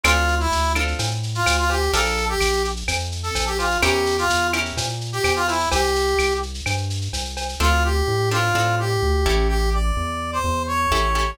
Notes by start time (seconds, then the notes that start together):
0.04 D2 C4 D4 F4 A4, cowbell, claves, shaker
0.17 shaker
0.28 shaker
0.40 E4, shaker
0.52 D2, shaker
0.64 shaker
0.75 C4 D4 F4 A4, claves, shaker
0.88 shaker
0.99 A2, cowbell, shaker
1.11 shaker
1.23 shaker
1.35 F4, shaker
1.46 D2, cowbell, claves, shaker
1.58 F4, shaker
1.69 G4, cowbell, shaker
1.82 shaker
1.93 A#1 D4 F4 A4 A#4, cowbell, shaker
2.06 shaker
2.17 shaker
2.29 G4, shaker
2.41 A#1, claves, shaker
2.53 shaker
2.64 shaker
2.76 shaker
2.88 F2, cowbell, claves, shaker
3.00 shaker
3.12 shaker
3.23 A4, shaker
3.35 A#1, cowbell, shaker
3.47 G4, shaker
3.58 F4, cowbell, shaker
3.71 shaker
3.82 E2 C#4 E4 G4 A#4, cowbell, claves, shaker
3.94 shaker
4.06 shaker
4.18 F4, shaker
4.30 E2, shaker
4.42 shaker
4.53 C#4 E4 G4 A#4, claves, shaker
4.65 shaker
4.77 A#2, cowbell, shaker
4.89 shaker
5.01 shaker
5.13 G4, shaker
5.24 E2, cowbell, claves, shaker
5.36 F4, shaker
5.48 E4, cowbell, shaker
5.60 shaker
5.71 C2 G4, cowbell, shaker
5.83 shaker
5.95 shaker
6.07 shaker
6.19 C2, claves, shaker
6.31 shaker
6.43 shaker
6.54 shaker
6.66 G2, cowbell, claves, shaker
6.78 shaker
6.90 shaker
7.02 shaker
7.13 C2, cowbell, shaker
7.25 shaker
7.37 cowbell, shaker
7.49 shaker
7.60 D2 C4 D4 F4 A4
7.84 G4
8.08 A2
8.31 C4 D4 F4 A4
8.55 A2 C4 D4 F4 A4
8.79 G4
9.02 D2
9.26 A1 C#4 E4 G4 A4
9.48 G4
9.73 D5
9.97 E2
10.33 C5
10.44 E2
10.67 C#5
10.91 A1 C#4 E4 G4 A4
11.15 C#4 E4 G4 A4